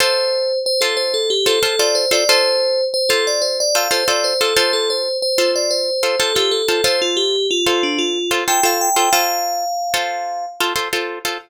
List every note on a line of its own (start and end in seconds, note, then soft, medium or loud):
0.00 0.52 F4 loud
0.00 0.52 A4 loud
0.00 0.52 C5 medium
0.00 0.59 C5 medium
0.66 0.82 C5 medium
0.81 1.34 F4 medium
0.81 0.96 A4 medium
0.81 1.34 A4 medium
0.81 1.34 C5 medium
0.97 1.12 C5 medium
1.14 1.29 A4 medium
1.30 1.46 G4 medium
1.46 1.59 F4 medium
1.46 1.59 A4 medium
1.46 1.63 A4 medium
1.46 1.59 C5 medium
1.63 1.76 F4 medium
1.63 1.76 A4 medium
1.63 1.79 A4 medium
1.63 1.76 C5 medium
1.79 2.05 F4 medium
1.79 2.05 A4 medium
1.79 2.05 C5 medium
1.79 1.95 D5 medium
1.95 2.11 C5 medium
2.11 2.24 F4 medium
2.11 2.24 A4 medium
2.11 2.24 C5 medium
2.11 2.28 D5 medium
2.29 2.81 F4 loud
2.29 2.81 A4 medium
2.29 2.81 C5 medium
2.29 2.84 C5 loud
2.94 3.09 C5 medium
3.09 3.62 F4 medium
3.09 3.25 A4 medium
3.09 3.62 A4 medium
3.09 3.62 C5 medium
3.27 3.43 D5 medium
3.42 3.57 C5 medium
3.60 3.76 D5 medium
3.75 3.88 F4 medium
3.75 3.88 A4 medium
3.75 3.88 C5 medium
3.75 3.92 F5 medium
3.91 4.04 F4 medium
3.91 4.04 A4 medium
3.91 4.04 C5 medium
3.91 4.07 C5 medium
4.08 4.34 F4 medium
4.08 4.34 A4 medium
4.08 4.34 C5 medium
4.08 4.24 D5 medium
4.24 4.40 C5 medium
4.41 4.54 F4 medium
4.41 4.56 A4 medium
4.41 4.54 A4 medium
4.41 4.54 C5 medium
4.56 5.09 F4 loud
4.56 5.09 A4 medium
4.56 4.72 C5 medium
4.56 5.09 C5 medium
4.73 4.89 A4 medium
4.90 5.17 C5 medium
5.22 5.51 C5 medium
5.38 5.90 F4 medium
5.38 5.90 A4 medium
5.38 5.90 C5 medium
5.56 5.71 D5 medium
5.71 6.18 C5 medium
6.03 6.16 F4 medium
6.03 6.16 A4 medium
6.03 6.16 C5 medium
6.19 6.33 F4 medium
6.19 6.35 A4 medium
6.19 6.33 A4 medium
6.19 6.33 C5 medium
6.35 6.62 F4 medium
6.35 6.51 G4 medium
6.35 6.62 A4 medium
6.35 6.62 C5 medium
6.51 6.83 A4 medium
6.68 6.81 F4 medium
6.68 6.81 A4 medium
6.68 6.81 C5 medium
6.84 7.36 F4 loud
6.84 7.36 A4 medium
6.84 7.36 C5 loud
6.84 7.00 C5 medium
7.02 7.17 F4 medium
7.17 7.47 G4 medium
7.51 7.82 F4 medium
7.66 8.19 F4 medium
7.66 8.19 A4 medium
7.66 8.19 C5 medium
7.83 7.99 D4 medium
7.99 8.40 F4 medium
8.31 8.44 F4 medium
8.31 8.44 A4 medium
8.31 8.44 C5 medium
8.48 8.61 F4 medium
8.48 8.61 A4 medium
8.48 8.61 C5 medium
8.48 8.63 G5 medium
8.63 8.89 F4 medium
8.63 8.89 A4 medium
8.63 8.89 C5 medium
8.63 8.81 F5 medium
8.81 9.12 G5 medium
8.96 9.09 F4 medium
8.96 9.09 A4 medium
8.96 9.09 C5 medium
9.13 9.65 F4 medium
9.13 9.65 A4 medium
9.13 9.65 C5 medium
9.13 10.44 F5 loud
9.94 10.46 F4 medium
9.94 10.46 A4 medium
9.94 10.46 C5 medium
10.60 10.74 F4 medium
10.60 10.74 A4 medium
10.60 10.74 C5 medium
10.76 10.89 F4 medium
10.76 10.89 A4 medium
10.76 10.89 C5 medium
10.93 11.19 F4 medium
10.93 11.19 A4 medium
10.93 11.19 C5 medium
11.25 11.38 F4 medium
11.25 11.38 A4 medium
11.25 11.38 C5 medium